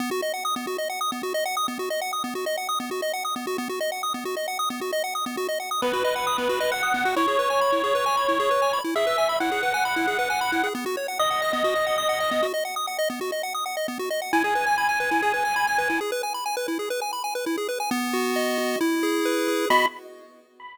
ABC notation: X:1
M:4/4
L:1/16
Q:1/4=134
K:B
V:1 name="Lead 1 (square)"
z16 | z16 | z16 | z4 B8 f4 |
c16 | e4 f12 | z4 d12 | z16 |
g16 | z16 | z16 | b4 z12 |]
V:2 name="Lead 1 (square)"
B, F d f d' B, F d f d' B, F d f d' B, | F d f d' B, F d f d' B, F d f d' B, F | B, F d f d' B, F d f d' B, F d f d' B, | F d f d' B, F d f d' B, F d f d' B, F |
E G B g b E G B g b E G B g b E | G B g b E G B g b E G B g b E G | B, F c f d' f d B, F d f d' f d B, F | d f d' f d B, F d f d' f d B, F d f |
E G B g b g B E G B g b g B E G | B g b g B E G B g b g B E G B g | B,2 F2 d2 F2 E2 G2 B2 G2 | [B,Fd]4 z12 |]